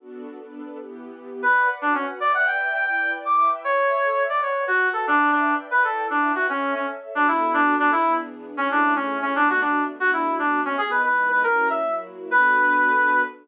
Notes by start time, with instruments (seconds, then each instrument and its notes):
0.00 string ensemble 1 B3 D4 F#4 A4
0.39 string ensemble 1 B3 D4 A4 B4
0.78 string ensemble 1 E3 B3 G4
1.42 brass section B4, string ensemble 1 B4 D5 F#5
1.81 brass section D4, string ensemble 1 F#4 B4 F#5
1.94 brass section C#4
2.20 string ensemble 1 B4 D5 E5 G5, brass section D5
2.34 brass section F#5
2.47 brass section G5
2.73 brass section G5
2.85 string ensemble 1 E4 B4 D5 G5, brass section G5
3.25 string ensemble 1 E4 B4 E5 G5, brass section D6
3.37 brass section D6
3.64 string ensemble 1 A4 C#5 E5, brass section C#5
4.29 string ensemble 1 B4 D5 F#5, brass section D5
4.42 brass section C#5
4.67 string ensemble 1 F#4 B4 F#5, brass section F#4
4.93 brass section A4
5.06 brass section D4, string ensemble 1 B4 D5 E5 G5
5.31 brass section D4
5.71 string ensemble 1 E4 B4 D5 G5, brass section B4
5.84 brass section A4
6.10 brass section D4, string ensemble 1 E4 B4 E5 G5
6.35 brass section F#4
6.49 brass section C#4, string ensemble 1 A4 C#5 E5
6.74 brass section C#4
7.14 string ensemble 1 B3 D4 F#4 A4, brass section D4
7.28 brass section E4
7.54 brass section D4
7.79 brass section D4
7.92 string ensemble 1 E3 B3 D4 G#4, brass section E4
8.57 string ensemble 1 A3 C#4 E4 G#4, brass section C#4
8.71 brass section D4
8.96 brass section C#4
9.22 brass section C#4
9.34 string ensemble 1 B2 A3 D4 F#4, brass section D4
9.49 brass section F#4
9.61 brass section D4
10.00 string ensemble 1 B2 A3 D4 F#4, brass section F#4
10.13 brass section E4
10.39 string ensemble 1 B2 A3 B3 F#4, brass section D4
10.65 brass section C#4
10.78 string ensemble 1 E3 G#3 B3 D#4, brass section G#4
10.91 brass section B4
11.04 brass section B4
11.29 brass section B4
11.43 string ensemble 1 F#3 A#3 C#4 E4, brass section A#4
11.70 brass section E5
11.84 string ensemble 1 F#3 A#3 E4 F#4
12.31 string ensemble 1 B3 D4 F#4 A4, brass section B4